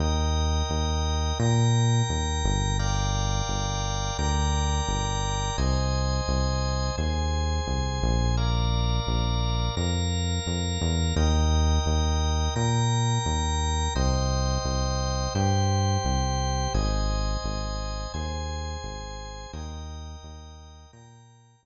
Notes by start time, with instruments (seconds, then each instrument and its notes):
0.00 synth bass 1 D#2, drawbar organ A#4 D#5 G5
0.70 synth bass 1 D#2
1.39 synth bass 1 A#2, drawbar organ A#4 G5 A#5
2.09 synth bass 1 D#2
2.44 synth bass 1 G1
2.79 drawbar organ A#4 D5 F5 G5
3.49 synth bass 1 G1
4.19 synth bass 1 D2, drawbar organ A#4 D5 G5 A#5
4.88 synth bass 1 G1
5.58 synth bass 1 C2, drawbar organ C5 D#5 G#5
6.28 synth bass 1 C2
6.98 synth bass 1 D#2, drawbar organ G#4 C5 G#5
7.67 synth bass 1 C2
8.02 synth bass 1 A#1
8.37 drawbar organ A#4 D5 F5
9.07 synth bass 1 A#1
9.77 synth bass 1 F2, drawbar organ A#4 F5 A#5
10.47 synth bass 1 F2
10.81 synth bass 1 E2
11.16 synth bass 1 D#2, drawbar organ A#4 D#5 G5
11.86 synth bass 1 D#2
12.56 synth bass 1 A#2, drawbar organ A#4 G5 A#5
13.26 synth bass 1 D#2
13.95 synth bass 1 C2, drawbar organ C5 D#5 G5
14.65 synth bass 1 C2
15.35 synth bass 1 G2, drawbar organ G4 C5 G5
16.05 synth bass 1 C2
16.74 synth bass 1 G#1, drawbar organ C5 D#5 G#5
17.44 synth bass 1 G#1
18.14 synth bass 1 D#2, drawbar organ G#4 C5 G#5
18.84 synth bass 1 G#1
19.53 synth bass 1 D#2, drawbar organ A#4 D#5 G5
20.23 synth bass 1 D#2
20.93 synth bass 1 A#2, drawbar organ A#4 G5 A#5
21.63 synth bass 1 D#2